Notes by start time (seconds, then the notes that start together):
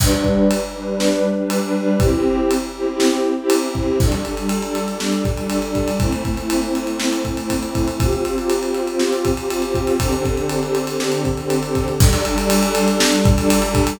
0.00 G3 D4 B4, kick, crash
0.12 G3 D4 B4
0.24 kick
0.51 ride
0.75 G3 D4 B4
0.88 G3 D4 B4
1.00 snare
1.38 G3 D4 B4
1.50 ride
1.62 G3 D4 B4
1.75 G3 D4 B4
2.00 C4 E4 G4, kick, ride
2.13 C4 E4 G4
2.51 ride
2.75 C4 E4 G4
2.87 C4 E4 G4
3.00 snare
3.37 C4 E4 G4
3.50 ride
3.63 C4 E4 G4
3.75 C4 E4 G4, kick
4.00 G3 D4 A4, kick, crash
4.12 G3 D4 A4, ride
4.25 G3 D4 A4, ride
4.37 G3 D4 A4, ride
4.49 ride
4.62 G3 D4 A4, ride
4.75 ride
4.88 G3 D4 A4, ride
5.00 snare
5.12 ride
5.25 kick, ride
5.37 G3 D4 A4, ride
5.50 ride
5.62 G3 D4 A4, ride
5.75 kick, ride
5.88 ride
6.00 A3 C4 E4, kick, ride
6.12 A3 C4 E4, ride
6.25 A3 C4 E4, kick, ride
6.37 A3 C4 E4, ride
6.50 ride
6.62 A3 C4 E4, ride
6.75 ride
6.87 A3 C4 E4, ride
7.00 snare
7.13 ride
7.25 kick, ride
7.37 A3 C4 E4, ride
7.50 kick, ride
7.62 A3 C4 E4, ride
7.75 kick, ride
7.88 ride
8.00 C4 F4 G4, kick, ride
8.13 C4 F4 G4, ride
8.25 C4 F4 G4, ride
8.37 C4 F4 G4, ride
8.50 ride
8.62 C4 F4 G4, ride
8.74 ride
8.87 C4 F4 G4, ride
8.99 snare
9.13 ride
9.25 kick, ride
9.37 C4 F4 G4, ride
9.50 ride
9.62 C4 F4 G4, ride
9.74 kick, ride
9.87 ride
10.00 D3 C4 G4 A4, kick, ride
10.12 D3 C4 G4 A4, ride
10.25 D3 C4 G4 A4, kick, ride
10.37 D3 C4 G4 A4, ride
10.49 ride
10.62 D3 C4 G4 A4, ride
10.75 ride
10.87 D3 C4 G4 A4, ride
11.00 snare
11.12 ride
11.25 kick, ride
11.37 D3 C4 G4 A4, ride
11.50 ride
11.62 D3 C4 G4 A4, ride
11.75 kick, ride
11.88 ride
11.99 G3 D4 A4, kick, crash
12.12 G3 D4 A4, ride
12.25 G3 D4 A4, ride
12.38 G3 D4 A4, ride
12.50 ride
12.62 G3 D4 A4, ride
12.75 ride
12.88 G3 D4 A4, ride
13.00 snare
13.12 ride
13.25 kick, ride
13.37 G3 D4 A4, ride
13.50 ride
13.62 G3 D4 A4, ride
13.75 kick, ride
13.87 ride